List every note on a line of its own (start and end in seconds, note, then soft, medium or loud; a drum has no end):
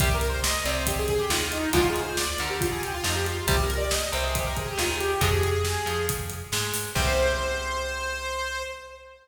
0.00 0.55 C2 loud
0.00 0.09 C3 medium
0.00 0.09 G3 medium
0.00 0.15 G4 medium
0.00 kick loud
0.00 closed hi-hat loud
0.14 0.28 A#4 medium
0.21 closed hi-hat medium
0.29 0.43 C5 medium
0.44 0.64 D#5 medium
0.44 snare loud
0.65 1.21 C2 loud
0.65 1.21 C3 loud
0.65 0.75 D5 medium
0.65 closed hi-hat medium
0.76 0.86 C5 medium
0.87 0.98 G4 medium
0.87 kick loud
0.87 closed hi-hat loud
0.98 1.09 G#4 medium
1.08 1.20 G#4 medium
1.08 kick medium
1.08 closed hi-hat medium
1.19 1.29 G4 medium
1.30 1.67 D#2 loud
1.30 1.67 D#3 loud
1.30 1.40 F4 medium
1.30 snare loud
1.41 1.52 F4 medium
1.52 1.70 D#4 medium
1.52 closed hi-hat medium
1.73 2.29 D2 loud
1.73 1.82 D3 medium
1.73 1.82 F3 medium
1.73 1.82 G#3 loud
1.73 1.87 F4 loud
1.73 kick loud
1.73 closed hi-hat loud
1.89 2.03 G#4 medium
1.96 closed hi-hat medium
2.03 2.17 C5 medium
2.17 2.38 D5 medium
2.17 snare loud
2.38 2.94 D2 loud
2.38 2.95 D3 medium
2.38 2.49 A#4 medium
2.38 closed hi-hat medium
2.50 2.60 G4 medium
2.60 2.71 F4 medium
2.60 kick loud
2.60 closed hi-hat loud
2.71 2.82 G#4 medium
2.82 2.93 G4 medium
2.82 closed hi-hat medium
2.93 3.04 F4 loud
3.04 3.41 F2 loud
3.04 3.40 F3 medium
3.04 3.15 D#4 medium
3.04 snare loud
3.15 3.26 G4 medium
3.26 3.45 F4 medium
3.26 closed hi-hat medium
3.47 4.03 C2 loud
3.47 3.56 C3 loud
3.47 3.56 G3 loud
3.47 3.61 G4 medium
3.47 kick loud
3.47 closed hi-hat loud
3.63 3.76 A#4 medium
3.70 closed hi-hat medium
3.77 3.91 D5 medium
3.91 4.10 D#5 medium
3.91 snare loud
4.12 4.69 C2 loud
4.12 4.68 C3 loud
4.12 4.24 C5 medium
4.12 closed hi-hat medium
4.23 4.34 G#4 medium
4.34 4.44 G4 medium
4.34 kick loud
4.34 closed hi-hat loud
4.46 4.56 A#4 medium
4.56 4.66 G#4 medium
4.56 kick medium
4.56 closed hi-hat medium
4.67 4.77 G4 medium
4.78 5.16 D#2 loud
4.78 5.14 D#3 medium
4.78 4.89 F4 medium
4.78 snare loud
4.90 5.00 G#4 medium
5.00 5.21 G4 medium
5.00 closed hi-hat medium
5.21 5.77 F2 loud
5.21 5.30 C3 loud
5.21 5.30 F3 loud
5.21 5.30 G#3 loud
5.21 6.06 G#4 medium
5.21 kick loud
5.21 closed hi-hat loud
5.43 closed hi-hat medium
5.65 snare loud
5.86 6.43 F2 medium
5.86 6.41 F3 medium
5.86 closed hi-hat medium
6.09 kick loud
6.09 closed hi-hat loud
6.30 closed hi-hat medium
6.52 6.89 G#2 loud
6.52 6.90 G#3 loud
6.52 snare loud
6.74 open hi-hat medium
6.95 8.64 C2 loud
6.95 8.63 C3 loud
6.95 8.63 G3 medium
6.95 8.63 C5 loud
6.95 kick loud
6.95 crash loud